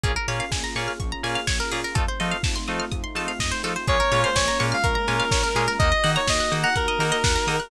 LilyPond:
<<
  \new Staff \with { instrumentName = "Lead 1 (square)" } { \time 4/4 \key bes \minor \tempo 4 = 125 r1 | r1 | des''8. c''16 des''8 r16 f''16 bes'2 | ees''8. des''16 ees''8 r16 ges''16 bes'2 | }
  \new Staff \with { instrumentName = "Electric Piano 2" } { \time 4/4 \key bes \minor <bes des' f' aes'>8 <bes des' f' aes'>4 <bes des' f' aes'>4 <bes des' f' aes'>4 <bes des' f' aes'>8 | <a c' ees' f'>8 <a c' ees' f'>4 <a c' ees' f'>4 <a c' ees' f'>4 <a c' ees' f'>8 | <aes bes des' f'>8 <aes bes des' f'>4 <aes bes des' f'>4 <aes bes des' f'>4 <aes bes des' f'>8 | <bes ees' ges'>8 <bes ees' ges'>4 <bes ees' ges'>4 <bes ees' ges'>4 <bes ees' ges'>8 | }
  \new Staff \with { instrumentName = "Pizzicato Strings" } { \time 4/4 \key bes \minor aes'16 bes'16 des''16 f''16 aes''16 bes''16 des'''16 f'''16 des'''16 bes''16 aes''16 f''16 des''16 bes'16 aes'16 bes'16 | a'16 c''16 ees''16 f''16 a''16 c'''16 ees'''16 f'''16 ees'''16 c'''16 a''16 f''16 ees''16 c''16 a'16 c''16 | aes'16 bes'16 des''16 f''16 aes''16 bes''16 des'''16 f'''16 des'''16 bes''16 aes''16 f''16 des''16 bes'16 aes'16 bes'16 | bes'16 ees''16 ges''16 bes''16 ees'''16 ges'''16 ees'''16 bes''16 ges''16 ees''16 bes'16 ees''16 ges''16 bes''16 ees'''16 ges'''16 | }
  \new Staff \with { instrumentName = "Synth Bass 1" } { \clef bass \time 4/4 \key bes \minor bes,,8 bes,8 bes,,8 bes,8 bes,,8 bes,8 bes,,8 bes,8 | f,8 f8 f,8 f8 f,8 f8 f,8 f8 | bes,,8 bes,8 bes,,8 bes,8 bes,,8 bes,8 bes,,8 bes,8 | ees,8 ees8 ees,8 ees8 ees,8 ees8 ees,8 ees8 | }
  \new Staff \with { instrumentName = "Pad 2 (warm)" } { \time 4/4 \key bes \minor <bes des' f' aes'>1 | <a c' ees' f'>1 | <aes bes des' f'>1 | <bes ees' ges'>1 | }
  \new DrumStaff \with { instrumentName = "Drums" } \drummode { \time 4/4 <hh bd>8 hho8 <bd sn>8 hho8 <hh bd>8 hho8 <bd sn>8 hho8 | <hh bd>8 hho8 <bd sn>8 hho8 <hh bd>8 hho8 <bd sn>8 hho8 | <hh bd>8 hho8 <bd sn>8 hho8 <hh bd>8 hho8 <bd sn>8 hho8 | <hh bd>8 hho8 <bd sn>8 hho8 <hh bd>8 hho8 <bd sn>8 hho8 | }
>>